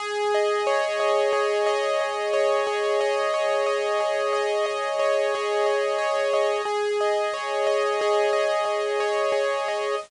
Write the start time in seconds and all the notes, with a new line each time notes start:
0.00 G#4
0.34 D#5
0.67 C#5
1.00 D#5
1.33 G#4
1.66 D#5
2.01 D#5
2.33 C#5
2.67 G#4
3.01 D#5
3.34 C#5
3.66 D#5
4.00 G#4
4.33 D#5
4.66 D#5
4.99 C#5
5.35 G#4
5.66 D#5
5.98 C#5
6.33 D#5
6.65 G#4
7.01 D#5
7.33 C#5
7.67 D#5
8.01 G#4
8.33 D#5
8.65 D#5
9.00 C#5
9.32 G#4
9.68 D#5